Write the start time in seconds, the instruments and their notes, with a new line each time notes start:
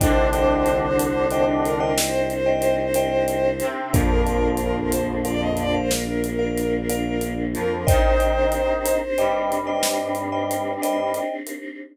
0.00 violin C2 C5, lead 1 (square) D3 D4, choir aahs C4 D4 D#4 G4, vibraphone C5 D5 D#5 G5, kick, closed hi-hat
0.32 vibraphone C5 D5 D#5 G5, closed hi-hat
0.66 closed hi-hat
0.99 closed hi-hat
1.31 vibraphone C5 D5 D#5 G5, closed hi-hat
1.64 violin A#4, closed hi-hat
1.80 vibraphone C5 D5 D#5 G5
1.97 violin C5, snare
2.30 closed hi-hat
2.46 vibraphone C5 D5 D#5 G5
2.62 closed hi-hat
2.94 vibraphone C5 D5 D#5 G5, closed hi-hat
3.28 closed hi-hat
3.60 lead 1 (square) C3 C4, closed hi-hat
3.93 violin A#1 A#4, lead 1 (square) F2 F3, choir aahs A#3 D4 F4, vibraphone A#4 D5 F5, kick, closed hi-hat
4.26 vibraphone A#4 D5 F5, closed hi-hat
4.57 violin A#4, closed hi-hat
4.92 violin C5, closed hi-hat
5.25 vibraphone A#4 D5 F5, violin D5, closed hi-hat
5.42 violin D#5
5.57 violin D5, closed hi-hat
5.74 vibraphone A#4 D5 F5, violin C5
5.90 violin A#4, snare
6.24 closed hi-hat
6.39 vibraphone A#4 D5 F5
6.58 closed hi-hat
6.89 vibraphone A#4 D5 F5, closed hi-hat
7.21 closed hi-hat
7.54 lead 1 (square) F2 F3, violin A#4, closed hi-hat
7.86 lead 1 (square) D#3 D#4, choir aahs C4 D4 D#4 G4, violin C5, vibraphone C5 D5 D#5 G5, kick, closed hi-hat
8.20 vibraphone C5 D5 D#5 G5, closed hi-hat
8.52 closed hi-hat
8.86 closed hi-hat
9.17 lead 1 (square) G2 G3, vibraphone C5 D5 D#5 G5, closed hi-hat
9.52 closed hi-hat
9.67 vibraphone C5 D5 D#5 G5
9.83 snare
10.15 closed hi-hat
10.32 vibraphone C5 D5 D#5 G5
10.51 closed hi-hat
10.82 vibraphone C5 D5 D#5 G5, closed hi-hat
11.14 closed hi-hat
11.47 closed hi-hat